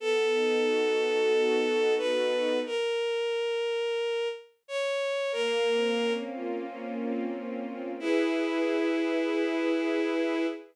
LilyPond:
<<
  \new Staff \with { instrumentName = "Violin" } { \time 4/4 \key e \lydian \tempo 4 = 90 a'2. b'4 | ais'2. cis''4 | ais'4. r2 r8 | e'1 | }
  \new Staff \with { instrumentName = "String Ensemble 1" } { \time 4/4 \key e \lydian b8 dis'8 fis'8 a'8 fis'8 dis'8 b8 dis'8 | r1 | ais8 bis8 cis'8 eis'8 cis'8 bis8 ais8 bis8 | <e' gis' b'>1 | }
>>